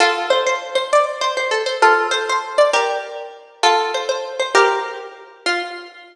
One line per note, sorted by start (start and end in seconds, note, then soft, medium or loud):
0.00 0.26 F4 loud
0.00 0.26 A4 loud
0.30 0.44 C5 medium
0.46 0.75 C5 medium
0.75 0.89 C5 loud
0.93 1.05 D5 loud
1.21 1.35 C5 medium
1.37 1.50 C5 medium
1.51 1.63 A4 medium
1.66 1.79 C5 medium
1.82 2.06 F4 medium
1.82 2.06 A4 medium
2.11 2.24 C5 medium
2.29 2.54 C5 medium
2.58 2.71 D5 medium
2.73 3.45 G4 medium
2.73 3.45 A#4 loud
3.63 3.91 F4 loud
3.63 3.91 A4 loud
3.94 4.08 C5 medium
4.09 4.34 C5 medium
4.39 4.53 C5 medium
4.55 4.83 G4 medium
4.55 4.83 A#4 loud
5.46 5.62 F4 loud